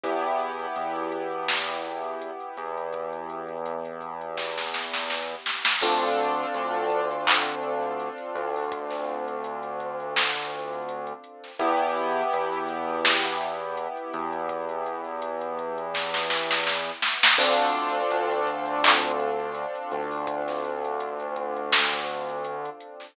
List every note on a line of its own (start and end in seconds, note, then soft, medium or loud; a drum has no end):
0.04 0.66 E2 medium
0.04 5.71 B3 medium
0.04 5.71 E4 medium
0.04 5.71 G4 medium
0.04 kick loud
0.04 closed hi-hat loud
0.23 closed hi-hat medium
0.40 closed hi-hat medium
0.59 closed hi-hat medium
0.76 2.31 E2 medium
0.76 closed hi-hat medium
0.96 closed hi-hat medium
1.12 closed hi-hat medium
1.31 closed hi-hat medium
1.48 snare loud
1.69 kick medium
1.69 closed hi-hat medium
1.85 closed hi-hat medium
2.04 closed hi-hat medium
2.22 closed hi-hat loud
2.40 closed hi-hat medium
2.57 5.35 E2 medium
2.57 closed hi-hat medium
2.78 closed hi-hat medium
2.93 kick medium
2.93 closed hi-hat medium
3.13 closed hi-hat medium
3.30 closed hi-hat medium
3.48 closed hi-hat medium
3.66 closed hi-hat loud
3.85 closed hi-hat medium
4.01 kick medium
4.01 closed hi-hat medium
4.21 closed hi-hat medium
4.38 kick medium
4.38 snare medium
4.58 snare medium
4.74 snare medium
4.94 snare medium
5.10 snare medium
5.46 snare medium
5.65 snare loud
5.82 6.45 D2 medium
5.82 11.50 C4 medium
5.82 11.50 D4 medium
5.82 11.50 F4 medium
5.82 11.50 A4 medium
5.82 kick loud
5.82 crash loud
6.02 closed hi-hat medium
6.19 closed hi-hat medium
6.37 closed hi-hat medium
6.55 8.09 D2 medium
6.55 closed hi-hat loud
6.74 closed hi-hat medium
6.90 kick medium
6.90 closed hi-hat medium
7.11 closed hi-hat medium
7.27 clap loud
7.46 kick medium
7.46 closed hi-hat medium
7.63 closed hi-hat medium
7.82 closed hi-hat medium
8.00 closed hi-hat medium
8.18 closed hi-hat medium
8.35 11.13 D2 medium
8.35 closed hi-hat medium
8.56 open hi-hat medium
8.72 kick loud
8.72 closed hi-hat loud
8.91 snare soft
8.91 closed hi-hat medium
9.08 closed hi-hat medium
9.28 closed hi-hat medium
9.44 closed hi-hat loud
9.63 closed hi-hat medium
9.80 kick medium
9.80 closed hi-hat medium
10.00 closed hi-hat medium
10.16 snare loud
10.35 kick medium
10.35 closed hi-hat medium
10.51 closed hi-hat medium
10.73 closed hi-hat medium
10.89 closed hi-hat loud
11.07 closed hi-hat medium
11.24 closed hi-hat medium
11.44 snare soft
11.44 closed hi-hat medium
11.59 12.23 E2 loud
11.59 17.27 B3 medium
11.59 17.27 E4 medium
11.59 17.27 G4 medium
11.59 kick loud
11.59 closed hi-hat loud
11.81 closed hi-hat medium
11.97 closed hi-hat medium
12.16 closed hi-hat medium
12.33 13.88 E2 medium
12.33 closed hi-hat loud
12.53 closed hi-hat medium
12.69 closed hi-hat loud
12.89 closed hi-hat medium
13.05 snare loud
13.24 kick medium
13.24 closed hi-hat medium
13.41 closed hi-hat medium
13.61 closed hi-hat medium
13.77 closed hi-hat loud
13.97 closed hi-hat medium
14.14 16.91 E2 medium
14.14 closed hi-hat medium
14.33 closed hi-hat medium
14.49 kick loud
14.49 closed hi-hat loud
14.69 closed hi-hat medium
14.86 closed hi-hat medium
15.05 closed hi-hat medium
15.22 closed hi-hat loud
15.41 closed hi-hat medium
15.59 kick medium
15.59 closed hi-hat medium
15.78 closed hi-hat medium
15.94 kick medium
15.94 snare medium
16.14 snare medium
16.30 snare medium
16.51 snare medium
16.67 snare medium
17.02 snare loud
17.23 snare loud
17.38 18.01 D2 loud
17.38 23.06 C4 medium
17.38 23.06 D4 medium
17.38 23.06 F4 medium
17.38 23.06 A4 medium
17.38 kick loud
17.38 crash loud
17.59 closed hi-hat medium
17.75 closed hi-hat medium
17.95 closed hi-hat medium
18.11 19.66 D2 medium
18.11 closed hi-hat loud
18.31 closed hi-hat medium
18.47 kick medium
18.47 closed hi-hat medium
18.66 closed hi-hat medium
18.84 clap loud
19.03 kick loud
19.03 closed hi-hat medium
19.20 closed hi-hat medium
19.40 closed hi-hat medium
19.55 closed hi-hat loud
19.75 closed hi-hat medium
19.92 22.70 D2 medium
19.92 closed hi-hat medium
20.11 open hi-hat medium
20.27 kick loud
20.27 closed hi-hat loud
20.48 snare soft
20.48 closed hi-hat medium
20.64 closed hi-hat medium
20.85 closed hi-hat medium
21.00 closed hi-hat loud
21.20 closed hi-hat medium
21.36 kick medium
21.36 closed hi-hat medium
21.56 closed hi-hat medium
21.73 snare loud
21.93 kick loud
21.93 closed hi-hat medium
22.09 closed hi-hat medium
22.29 closed hi-hat medium
22.45 closed hi-hat loud
22.65 closed hi-hat medium
22.81 closed hi-hat loud
23.00 snare soft
23.00 closed hi-hat medium